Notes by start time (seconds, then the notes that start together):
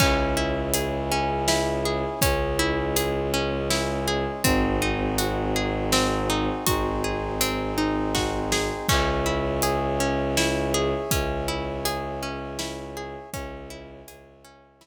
0.00 C#2 C#4 E4 G#4, kick, crash
0.37 E4
0.74 G#4, closed hi-hat
1.12 C#4
1.48 E4, snare
1.85 G#4
2.21 C#2 G#3 C#4 G#4, kick, closed hi-hat
2.59 E4
2.96 G#4, closed hi-hat
3.34 C#4
3.70 E4, snare
4.08 G#4
4.44 G#1 C4 D#4 F#4 G#4, kick, closed hi-hat
4.82 D#4
5.18 F#4, closed hi-hat
5.56 G#4
5.92 C4, snare
6.30 D#4
6.67 G#1 C4 D#4 F#4 G#4 C5, kick, closed hi-hat
7.04 G#4
7.41 C4, closed hi-hat
7.78 D#4
8.15 F#4, kick, snare
8.52 G#4, snare
8.89 C#2 C#4 C#5 E5 G#5, kick, crash
9.26 E4
9.62 G#4, closed hi-hat
10.00 C#4
10.37 E4, snare
10.74 G#4
11.11 C#2 C#4, kick, closed hi-hat
11.48 E4
11.85 G#4, closed hi-hat
12.23 C#4
12.59 E4, snare
12.97 G#4
13.32 C#2 C#4 C#5 E5 G#5, kick, closed hi-hat
13.70 E4
14.08 C#2 G#4, closed hi-hat
14.44 C#4
14.81 E4, snare